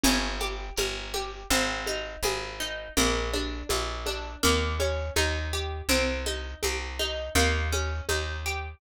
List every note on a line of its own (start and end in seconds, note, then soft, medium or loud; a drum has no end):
0.04 0.70 G1 loud
0.04 0.37 C#4 medium
0.04 low conga loud
0.04 shaker medium
0.40 0.74 G4 medium
0.40 high conga medium
0.40 shaker medium
0.76 1.44 G1 medium
0.76 1.10 A#4 medium
0.76 high conga loud
0.76 shaker medium
1.13 1.47 G4 medium
1.13 high conga medium
1.13 shaker medium
1.50 2.16 G#1 loud
1.50 1.83 C4 medium
1.50 low conga medium
1.50 shaker medium
1.86 2.20 D#4 medium
1.86 high conga medium
1.86 shaker medium
2.23 2.88 G#1 medium
2.23 2.57 G#4 medium
2.23 high conga loud
2.23 shaker medium
2.60 2.93 D#4 medium
2.60 shaker medium
2.97 3.63 A#1 medium
2.97 3.30 A#3 medium
2.97 low conga loud
2.97 shaker medium
3.34 3.66 D4 medium
3.34 high conga medium
3.34 shaker medium
3.69 4.36 A#1 medium
3.69 4.03 F4 medium
3.69 high conga loud
3.69 shaker medium
4.06 4.39 D4 medium
4.06 high conga medium
4.06 shaker medium
4.43 5.10 D#2 medium
4.43 4.76 A#3 loud
4.43 low conga loud
4.43 shaker medium
4.79 5.13 C#4 medium
4.79 high conga medium
4.79 shaker medium
5.16 5.82 D#2 medium
5.16 5.49 D#4 medium
5.16 high conga loud
5.16 shaker medium
5.53 5.86 G4 medium
5.53 shaker medium
5.89 6.55 C2 medium
5.89 6.22 C4 medium
5.89 low conga loud
5.89 shaker medium
6.26 6.59 D#4 medium
6.26 high conga medium
6.26 shaker medium
6.63 7.29 C2 medium
6.63 6.96 G4 medium
6.63 high conga loud
6.63 shaker medium
6.99 7.32 D#4 medium
6.99 high conga medium
6.99 shaker medium
7.35 8.01 D#2 medium
7.35 7.69 A#3 medium
7.35 low conga loud
7.35 shaker medium
7.72 8.05 C#4 medium
7.72 high conga medium
7.72 shaker medium
8.09 8.75 D#2 medium
8.09 8.42 D#4 medium
8.09 high conga loud
8.09 shaker medium
8.45 8.79 G4 medium
8.45 shaker medium